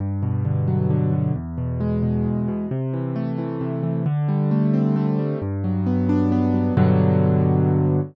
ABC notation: X:1
M:3/4
L:1/8
Q:1/4=133
K:G
V:1 name="Acoustic Grand Piano"
G,, B,, D, F, D, B,, | E,, B,, ^G, B,, E,, B,, | C, E, A, E, C, E, | D, G, A, C A, G, |
G,, F, B, D B, F, | [G,,B,,D,F,]6 |]